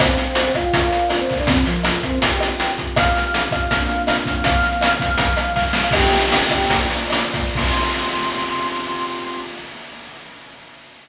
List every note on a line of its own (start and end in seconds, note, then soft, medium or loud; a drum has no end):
0.00 0.52 C4 loud
0.00 0.52 C5 loud
0.00 0.74 C5 medium
0.00 0.74 F5 medium
0.00 0.74 G5 medium
0.00 kick loud
0.00 cross-stick loud
0.00 closed hi-hat loud
0.17 snare medium
0.17 closed hi-hat medium
0.35 closed hi-hat loud
0.55 0.64 F4 medium
0.55 0.64 F5 loud
0.55 kick medium
0.55 cross-stick loud
0.55 closed hi-hat medium
0.65 0.74 F4 loud
0.65 0.74 F5 loud
0.73 1.09 F4 medium
0.73 1.47 A#4 medium
0.73 1.47 C5 medium
0.73 1.47 D5 medium
0.73 1.09 F5 loud
0.73 1.47 F5 medium
0.73 kick loud
0.73 closed hi-hat loud
0.93 closed hi-hat medium
1.10 1.20 F4 medium
1.10 1.20 F5 loud
1.10 cross-stick loud
1.10 closed hi-hat loud
1.20 1.38 C4 medium
1.20 1.38 C5 loud
1.29 kick medium
1.29 open hi-hat medium
1.39 1.48 D4 medium
1.39 1.48 D5 loud
1.47 1.66 C3 loud
1.47 1.66 C4 loud
1.47 2.22 F4 medium
1.47 2.22 A#4 medium
1.47 2.22 C5 medium
1.47 kick loud
1.47 closed hi-hat loud
1.65 2.00 F3 medium
1.65 2.00 F4 loud
1.65 snare medium
1.65 closed hi-hat medium
1.83 cross-stick medium
1.83 closed hi-hat loud
2.03 2.19 C4 loud
2.03 2.19 C5 loud
2.03 kick medium
2.03 closed hi-hat medium
2.22 2.95 C4 medium
2.22 2.95 F4 medium
2.22 2.95 G4 medium
2.22 2.71 G4 medium
2.22 2.71 G5 loud
2.22 kick medium
2.22 closed hi-hat loud
2.40 cross-stick loud
2.40 closed hi-hat loud
2.60 closed hi-hat loud
2.78 kick medium
2.78 closed hi-hat medium
2.96 3.70 C4 medium
2.96 3.70 F4 medium
2.96 3.70 G4 medium
2.96 3.48 F5 loud
2.96 3.48 F6 loud
2.96 kick loud
2.96 cross-stick loud
2.96 closed hi-hat loud
3.15 snare medium
3.15 closed hi-hat medium
3.34 closed hi-hat loud
3.51 3.61 F5 medium
3.51 3.61 F6 loud
3.51 kick loud
3.51 cross-stick loud
3.51 closed hi-hat medium
3.61 3.70 F5 medium
3.61 3.70 F6 medium
3.70 4.44 A#3 medium
3.70 4.44 C4 medium
3.70 4.44 D4 medium
3.70 4.44 F4 medium
3.70 4.02 F5 medium
3.70 4.02 F6 loud
3.70 kick medium
3.70 closed hi-hat loud
3.89 closed hi-hat medium
4.07 4.16 F5 loud
4.07 4.16 F6 loud
4.07 cross-stick loud
4.07 closed hi-hat loud
4.17 4.33 F5 medium
4.17 4.33 F6 loud
4.26 kick loud
4.26 closed hi-hat medium
4.35 4.44 F5 medium
4.35 4.44 F6 loud
4.44 5.18 F3 medium
4.44 5.18 A#3 medium
4.44 5.18 C4 medium
4.44 4.94 F5 loud
4.44 4.94 F6 loud
4.44 kick loud
4.44 closed hi-hat loud
4.62 snare medium
4.62 closed hi-hat medium
4.81 cross-stick loud
4.81 closed hi-hat loud
5.00 5.09 F5 loud
5.00 5.09 F6 loud
5.00 kick loud
5.00 closed hi-hat loud
5.09 5.18 F5 loud
5.09 5.18 F6 loud
5.18 5.92 C3 medium
5.18 5.92 F3 medium
5.18 5.92 G3 medium
5.18 5.52 F5 medium
5.18 5.52 F6 loud
5.18 kick loud
5.18 closed hi-hat loud
5.37 cross-stick loud
5.37 closed hi-hat loud
5.56 5.64 F5 loud
5.56 5.64 F6 loud
5.56 kick medium
5.56 snare medium
5.65 5.82 F5 medium
5.65 5.82 F6 medium
5.73 snare loud
5.83 5.92 F5 loud
5.83 5.92 F6 loud
5.91 6.69 C4 medium
5.91 6.69 F4 medium
5.91 6.69 G4 medium
5.91 6.87 G4 loud
5.91 6.87 G5 loud
5.91 kick loud
5.91 cross-stick loud
5.91 crash loud
6.11 snare medium
6.11 closed hi-hat medium
6.32 closed hi-hat loud
6.50 kick medium
6.50 cross-stick loud
6.50 closed hi-hat medium
6.69 7.55 A#3 medium
6.69 7.55 F4 medium
6.69 7.55 C5 medium
6.69 7.55 D5 medium
6.69 kick medium
6.69 closed hi-hat loud
6.90 closed hi-hat medium
7.10 cross-stick loud
7.10 closed hi-hat loud
7.34 kick loud
7.34 closed hi-hat medium
7.55 9.38 C4 loud
7.55 9.38 F4 medium
7.55 9.38 G4 medium
7.55 9.38 C6 loud
7.55 kick loud
7.55 crash loud